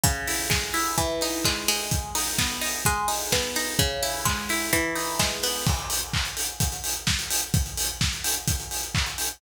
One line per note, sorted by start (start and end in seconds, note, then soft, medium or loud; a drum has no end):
0.04 0.93 C#3 medium
0.04 kick loud
0.04 closed hi-hat loud
0.28 0.73 E4 medium
0.28 open hi-hat medium
0.50 0.94 G#3 medium
0.50 kick medium
0.50 snare loud
0.74 0.96 E4 medium
0.74 open hi-hat medium
0.98 1.87 E3 medium
0.98 kick medium
0.98 closed hi-hat medium
1.21 1.89 D#4 medium
1.21 open hi-hat medium
1.45 1.68 G#3 medium
1.45 kick medium
1.45 clap loud
1.68 2.81 G#3 medium
1.68 open hi-hat medium
1.91 kick loud
1.91 closed hi-hat loud
2.15 2.61 D#4 medium
2.15 open hi-hat medium
2.38 2.83 B3 medium
2.38 kick medium
2.38 snare loud
2.61 2.84 D#4 medium
2.61 open hi-hat medium
2.85 3.75 G#3 medium
2.85 kick medium
2.85 closed hi-hat loud
3.08 3.56 D#4 medium
3.08 open hi-hat medium
3.32 3.77 B3 medium
3.32 kick medium
3.32 snare loud
3.56 3.78 D#4 medium
3.56 open hi-hat medium
3.79 4.68 C#3 medium
3.79 kick loud
3.79 closed hi-hat medium
4.03 4.49 E4 medium
4.03 open hi-hat medium
4.25 4.70 G#3 medium
4.25 kick medium
4.25 clap loud
4.49 4.72 E4 medium
4.49 open hi-hat medium
4.73 5.62 E3 medium
4.73 kick medium
4.73 closed hi-hat loud
4.96 5.62 D#4 medium
4.96 open hi-hat medium
5.19 5.64 G#3 medium
5.19 kick medium
5.19 snare loud
5.43 5.66 B3 medium
5.43 open hi-hat medium
5.67 kick loud
5.67 crash loud
5.79 closed hi-hat medium
5.90 open hi-hat medium
6.02 closed hi-hat medium
6.13 kick medium
6.13 clap loud
6.25 closed hi-hat medium
6.37 open hi-hat medium
6.48 closed hi-hat medium
6.60 kick medium
6.60 closed hi-hat loud
6.72 closed hi-hat medium
6.84 open hi-hat medium
6.96 closed hi-hat medium
7.07 kick medium
7.07 snare loud
7.19 closed hi-hat medium
7.31 open hi-hat medium
7.42 closed hi-hat medium
7.54 kick loud
7.54 closed hi-hat loud
7.66 closed hi-hat medium
7.77 open hi-hat medium
7.89 closed hi-hat medium
8.01 kick medium
8.01 snare loud
8.13 closed hi-hat medium
8.24 open hi-hat medium
8.36 closed hi-hat medium
8.48 kick medium
8.48 closed hi-hat loud
8.60 closed hi-hat medium
8.71 open hi-hat medium
8.83 closed hi-hat medium
8.95 kick medium
8.95 clap loud
9.06 closed hi-hat medium
9.18 open hi-hat medium
9.30 closed hi-hat medium